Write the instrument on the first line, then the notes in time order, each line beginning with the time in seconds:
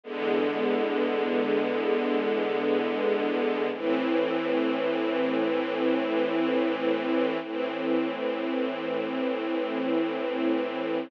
string ensemble 1
0.03 E2 D3 G#3 B3
3.72 A2 E3 C4
7.42 A2 E3 C4